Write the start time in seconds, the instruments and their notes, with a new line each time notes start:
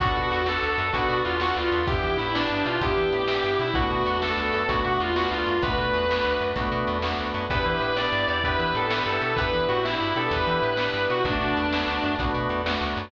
0.00 electric bass (finger) B1, drawbar organ B3 D4 F#4 A4, distortion guitar F#4, kick, closed hi-hat
0.15 electric bass (finger) B2, distortion guitar F#4
0.31 electric bass (finger) E2, distortion guitar F#4, closed hi-hat
0.46 drawbar organ B3 D4 F#4 A4, distortion guitar A4, snare
0.63 electric bass (finger) D2
0.78 electric bass (finger) F#2, distortion guitar A4, closed hi-hat
0.92 electric bass (finger) B1, drawbar organ B3 D4 F#4 A4, distortion guitar F#4, kick, closed hi-hat
1.08 electric bass (finger) B2, distortion guitar F#4
1.25 electric bass (finger) E2, distortion guitar F4, closed hi-hat
1.40 drawbar organ B3 D4 F#4 A4, distortion guitar F#4, snare
1.56 electric bass (finger) D2, distortion guitar F4
1.72 electric bass (finger) E2, open hi-hat
1.87 drawbar organ B3 D4 E4 G4, distortion guitar G4, kick, closed hi-hat
2.03 electric bass (finger) E3
2.17 electric bass (finger) A2, distortion guitar E4, closed hi-hat
2.34 drawbar organ B3 D4 E4 G4, distortion guitar D4, snare
2.50 electric bass (finger) G2
2.65 electric bass (finger) B2, distortion guitar F4, closed hi-hat
2.81 electric bass (finger) E2, drawbar organ B3 D4 E4 G4, distortion guitar G4, kick, closed hi-hat
2.97 electric bass (finger) E3
3.12 electric bass (finger) A2, closed hi-hat
3.28 drawbar organ B3 D4 E4 G4, snare
3.44 electric bass (finger) G2
3.59 electric bass (finger) B2, distortion guitar E4, closed hi-hat
3.74 electric bass (finger) B1, drawbar organ A3 B3 D4 F#4, distortion guitar F#4, kick
3.90 electric bass (finger) B2, distortion guitar F#4
4.05 electric bass (finger) E2, distortion guitar F#4, closed hi-hat
4.21 drawbar organ A3 B3 D4 F#4, distortion guitar A4, snare
4.38 electric bass (finger) D2
4.53 electric bass (finger) F#2, distortion guitar A4, closed hi-hat
4.68 electric bass (finger) B1, drawbar organ A3 B3 D4 F#4, distortion guitar F#4, kick, closed hi-hat
4.85 electric bass (finger) B2, distortion guitar F#4
5.00 electric bass (finger) E2, distortion guitar F4, closed hi-hat
5.16 drawbar organ A3 B3 D4 F#4, distortion guitar F#4, snare
5.31 electric bass (finger) D2, distortion guitar F4
5.47 electric bass (finger) F#2, closed hi-hat
5.62 electric bass (finger) B1, drawbar organ A3 B3 D4 F#4, distortion guitar B4, kick, closed hi-hat
5.78 electric bass (finger) B2
5.93 electric bass (finger) E2, closed hi-hat
6.09 drawbar organ A3 B3 D4 F#4, snare
6.25 electric bass (finger) D2
6.41 electric bass (finger) F#2, closed hi-hat
6.56 electric bass (finger) B1, drawbar organ A3 B3 D4 F#4, kick, closed hi-hat
6.72 electric bass (finger) B2
6.87 electric bass (finger) E2, closed hi-hat
7.02 drawbar organ A3 B3 D4 F#4, snare
7.19 electric bass (finger) D2
7.34 electric bass (finger) F#2, closed hi-hat
7.50 electric bass (finger) E2, drawbar organ B3 D4 E4 G4, distortion guitar B4, kick, closed hi-hat
7.66 electric bass (finger) E3, distortion guitar B4
7.80 electric bass (finger) A2, distortion guitar B4, closed hi-hat
7.96 drawbar organ B3 D4 E4 G4, distortion guitar D5, snare
8.12 electric bass (finger) G2
8.28 electric bass (finger) E2, distortion guitar D5, closed hi-hat
8.43 drawbar organ B3 D4 E4 G4, distortion guitar B4, kick, closed hi-hat
8.58 electric bass (finger) E3, distortion guitar B4
8.75 electric bass (finger) A2, distortion guitar A4, closed hi-hat
8.90 drawbar organ B3 D4 E4 G4, distortion guitar B4, snare
9.06 electric bass (finger) G2, distortion guitar A4
9.21 electric bass (finger) B2, closed hi-hat
9.36 electric bass (finger) E2, drawbar organ B3 D4 E4 G4, distortion guitar B4, kick, closed hi-hat
9.53 electric bass (finger) E3
9.68 electric bass (finger) A2, distortion guitar F#4, closed hi-hat
9.84 drawbar organ B3 D4 E4 G4, distortion guitar E4, snare
10.00 electric bass (finger) G2
10.15 electric bass (finger) B2, drawbar organ B3 D4 E4 G4, distortion guitar A4, closed hi-hat
10.31 electric bass (finger) E2, distortion guitar B4, kick, closed hi-hat
10.47 electric bass (finger) E3
10.62 electric bass (finger) A2, closed hi-hat
10.77 drawbar organ B3 D4 E4 G4, snare
10.94 electric bass (finger) G2
11.10 electric bass (finger) B2, distortion guitar F#4, closed hi-hat
11.25 electric bass (finger) B1, drawbar organ A3 B3 D4 F#4, distortion guitar D4, kick, closed hi-hat
11.41 electric bass (finger) B2
11.57 electric bass (finger) E2, closed hi-hat
11.73 drawbar organ A3 B3 D4 F#4, snare
11.87 electric bass (finger) D2
12.03 electric bass (finger) F#2, closed hi-hat
12.19 electric bass (finger) B1, drawbar organ A3 B3 D4 F#4, kick, closed hi-hat
12.34 electric bass (finger) B2
12.49 electric bass (finger) E2, closed hi-hat
12.65 drawbar organ A3 B3 D4 F#4, snare
12.81 electric bass (finger) D2
12.97 electric bass (finger) F#2, closed hi-hat